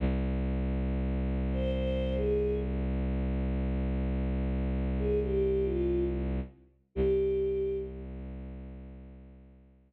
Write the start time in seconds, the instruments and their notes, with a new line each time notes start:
0.00 violin C2
1.52 choir aahs C5
1.72 choir aahs C5
2.15 choir aahs G#4
4.99 choir aahs G#4
5.23 choir aahs G4
5.63 choir aahs F4
6.95 violin C2, choir aahs G4